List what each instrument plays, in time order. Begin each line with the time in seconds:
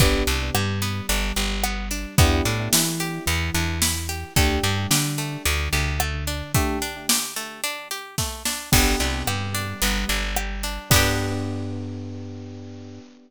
0.00 electric bass (finger) G1, acoustic guitar (steel) B3, electric piano 2 B3 D4 G4, kick, closed hi-hat
0.27 electric bass (finger) C2, electric piano 2 C3, acoustic guitar (steel) D4, closed hi-hat
0.54 electric bass (finger) G2, electric piano 2 G3, acoustic guitar (steel) G4, cross-stick
0.82 acoustic guitar (steel) B3, closed hi-hat
1.09 electric bass (finger) G1, electric piano 2 G3, acoustic guitar (steel) D4, closed hi-hat
1.36 electric bass (finger) G1, electric piano 2 G3, acoustic guitar (steel) G4, closed hi-hat
1.64 acoustic guitar (steel) B3, cross-stick
1.91 acoustic guitar (steel) D4, closed hi-hat
2.18 electric bass (finger) E2, acoustic guitar (steel) B3, electric piano 2 B3 D4 E4 G4, kick, closed hi-hat
2.45 electric bass (finger) A2, electric piano 2 A3, acoustic guitar (steel) D4, closed hi-hat
2.73 electric bass (finger) E3, electric piano 2 E4, acoustic guitar (steel) E4, snare
3.00 acoustic guitar (steel) G4, closed hi-hat
3.26 electric bass (finger) E2, electric piano 2 E3, acoustic guitar (steel) B3, closed hi-hat
3.54 electric bass (finger) E2, electric piano 2 E3, acoustic guitar (steel) D4, closed hi-hat
3.82 acoustic guitar (steel) E4, snare
4.09 acoustic guitar (steel) G4, closed hi-hat
4.36 electric bass (finger) D2, acoustic guitar (steel) A3, electric piano 2 A3 D4 G4, kick, closed hi-hat
4.63 electric bass (finger) G2, electric piano 2 G3, acoustic guitar (steel) D4, closed hi-hat
4.91 electric bass (finger) D3, electric piano 2 D4, acoustic guitar (steel) G4, snare
5.18 acoustic guitar (steel) A3, closed hi-hat
5.45 electric bass (finger) D2, electric piano 2 D3, acoustic guitar (steel) D4, closed hi-hat
5.73 electric bass (finger) D2, electric piano 2 D3, acoustic guitar (steel) G4, closed hi-hat
6.00 acoustic guitar (steel) A3, cross-stick
6.27 acoustic guitar (steel) D4, closed hi-hat
6.54 acoustic guitar (steel) A3, electric piano 2 A3 D4 G4, kick, closed hi-hat
6.82 acoustic guitar (steel) D4, closed hi-hat
7.09 acoustic guitar (steel) G4, snare
7.36 acoustic guitar (steel) A3, closed hi-hat
7.64 acoustic guitar (steel) D4, closed hi-hat
7.91 acoustic guitar (steel) G4, closed hi-hat
8.18 acoustic guitar (steel) A3, kick, snare
8.45 acoustic guitar (steel) D4, snare
8.72 electric bass (finger) G1, electric piano 2 B3 D4 G4, acoustic guitar (steel) B3, kick, crash
9.00 electric bass (finger) C2, electric piano 2 C3, acoustic guitar (steel) D4, closed hi-hat
9.27 electric bass (finger) G2, electric piano 2 G3, acoustic guitar (steel) G4, cross-stick
9.55 acoustic guitar (steel) D4, closed hi-hat
9.82 electric bass (finger) G1, electric piano 2 G3, acoustic guitar (steel) B3, closed hi-hat
10.08 electric bass (finger) G1, electric piano 2 G3, acoustic guitar (steel) D4, closed hi-hat
10.36 acoustic guitar (steel) G4, cross-stick
10.63 acoustic guitar (steel) D4, closed hi-hat
10.90 electric bass (finger) G2, electric piano 2 B3 D4 G4, acoustic guitar (steel) B3 D4, kick, crash
10.96 acoustic guitar (steel) G4